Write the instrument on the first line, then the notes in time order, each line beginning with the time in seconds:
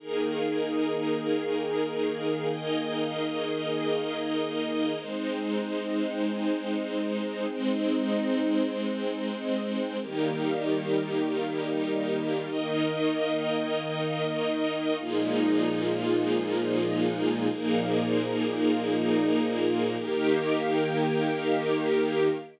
string ensemble 1
0.00 D#3 A#3 D#4 G#4 A#4
2.51 D#4 A#4 D#5
4.99 G#3 C4 D#4 C5
7.50 G#3 C4 C5
10.01 D#3 G3 A#3 D#4 G4 A#4
12.49 D#3 A#3 D#4 A#4 D#5
15.00 A#2 F3 G#3 A#3 D#4 F4 G#4
17.49 A#2 F3 A#3 D#4 G#4 A#4
20.00 D#3 A#3 D#4 G4 A#4